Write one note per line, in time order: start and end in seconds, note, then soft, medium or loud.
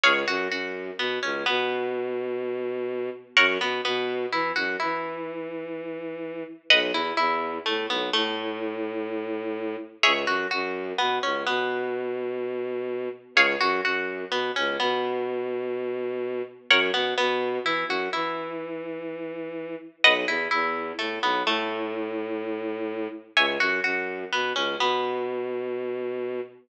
0.03 0.24 C#2 loud
0.03 0.13 G#4 loud
0.03 0.13 C#5 loud
0.03 0.13 F5 loud
0.28 0.48 F#2 loud
0.28 0.48 F#4 loud
0.50 0.91 F#2 medium
0.50 0.92 F#4 medium
0.99 1.19 B2 medium
0.99 1.19 B3 medium
1.23 1.43 C#2 medium
1.23 1.43 C#4 medium
1.46 3.10 B2 loud
1.46 3.08 B3 medium
3.37 3.58 F#2 loud
3.37 3.46 A#4 loud
3.37 3.46 C#5 loud
3.37 3.46 F#5 loud
3.60 3.81 B2 medium
3.60 3.81 B3 medium
3.85 4.26 B2 loud
3.85 4.25 B3 medium
4.32 4.52 E3 medium
4.32 4.53 E4 medium
4.56 4.76 F#2 medium
4.56 4.76 F#4 medium
4.80 6.43 E3 medium
4.80 6.42 E4 medium
6.70 6.91 B1 loud
6.70 6.80 B4 loud
6.70 6.80 D#5 loud
6.70 6.80 F#5 loud
6.92 7.12 E2 medium
6.92 7.15 E4 medium
7.17 7.59 E2 loud
7.17 7.58 E4 medium
7.66 7.87 A2 medium
7.66 7.86 A3 medium
7.89 8.10 B1 medium
7.89 8.10 B3 medium
8.13 9.76 A2 loud
8.13 9.75 A3 loud
10.03 10.25 C#2 loud
10.03 10.13 G#4 loud
10.03 10.13 C#5 loud
10.03 10.13 E5 loud
10.26 10.46 F#2 loud
10.26 10.47 F#4 medium
10.51 10.93 F#2 loud
10.51 10.91 F#4 medium
10.98 11.19 B2 medium
10.98 11.19 B3 medium
11.23 11.44 C#2 medium
11.23 11.43 C#4 medium
11.47 13.09 B2 loud
11.47 13.08 B3 medium
13.35 13.55 C#2 loud
13.35 13.46 G#4 loud
13.35 13.46 C#5 loud
13.35 13.46 F5 loud
13.61 13.81 F#2 loud
13.61 13.81 F#4 loud
13.84 14.25 F#2 medium
13.84 14.25 F#4 medium
14.31 14.51 B2 medium
14.31 14.52 B3 medium
14.56 14.77 C#2 medium
14.56 14.76 C#4 medium
14.80 16.42 B2 loud
14.80 16.42 B3 medium
16.70 16.91 F#2 loud
16.70 16.80 A#4 loud
16.70 16.80 C#5 loud
16.70 16.80 F#5 loud
16.94 17.14 B2 medium
16.94 17.14 B3 medium
17.18 17.59 B2 loud
17.18 17.58 B3 medium
17.64 17.84 E3 medium
17.64 17.86 E4 medium
17.88 18.08 F#2 medium
17.88 18.10 F#4 medium
18.13 19.75 E3 medium
18.13 19.75 E4 medium
20.04 20.25 B1 loud
20.04 20.14 B4 loud
20.04 20.14 D#5 loud
20.04 20.14 F#5 loud
20.27 20.48 E2 medium
20.27 20.48 E4 medium
20.51 20.93 E2 loud
20.51 20.91 E4 medium
20.99 21.19 A2 medium
20.99 21.19 A3 medium
21.22 21.42 B1 medium
21.22 21.43 B3 medium
21.46 23.08 A2 loud
21.46 23.09 A3 loud
23.37 23.57 C#2 loud
23.37 23.46 C#5 loud
23.37 23.46 E5 loud
23.37 23.46 G#5 loud
23.60 23.80 F#2 loud
23.60 23.80 F#4 medium
23.84 24.25 F#2 medium
23.84 24.25 F#4 medium
24.32 24.53 B2 medium
24.32 24.53 B3 medium
24.55 24.75 C#2 medium
24.55 24.76 C#4 medium
24.79 26.41 B2 medium
24.79 26.42 B3 medium